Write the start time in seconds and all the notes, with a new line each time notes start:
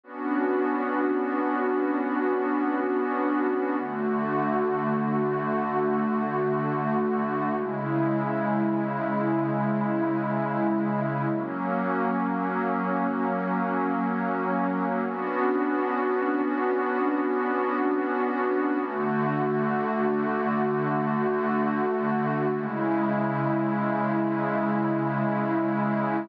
0.04 B3 C#4 D4 F#4
3.79 D3 A3 F#4
7.55 C#3 G#3 E4
11.30 F#3 A#3 C#4
15.06 B3 C#4 D4 F#4
18.80 D3 A3 F#4
22.55 C#3 G#3 E4